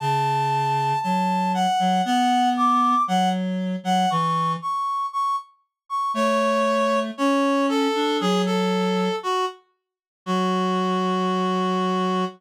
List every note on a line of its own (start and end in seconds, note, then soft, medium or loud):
0.00 0.93 C#3 loud
0.00 0.99 A5 loud
1.02 1.66 F#3 medium
1.02 1.52 A5 loud
1.54 2.02 F#5 loud
1.79 2.01 F#3 loud
2.05 2.95 B3 loud
2.05 2.49 F#5 loud
2.57 3.02 D6 loud
3.08 3.76 F#3 loud
3.08 3.29 F#5 loud
3.83 4.06 F#3 loud
3.83 4.09 F#5 loud
4.10 4.56 E3 loud
4.10 4.52 C#6 loud
4.62 5.06 C#6 loud
5.13 5.36 C#6 loud
5.89 6.12 C#6 loud
6.14 7.11 A3 loud
6.14 6.99 C#5 loud
7.18 7.88 C#4 loud
7.18 7.66 C#5 loud
7.69 8.17 A4 loud
7.95 8.20 D4 loud
8.21 9.09 F#3 loud
8.21 8.42 G#4 loud
8.46 9.16 A4 loud
9.23 9.45 F#4 loud
10.26 12.25 F#3 loud
10.26 12.25 F#4 loud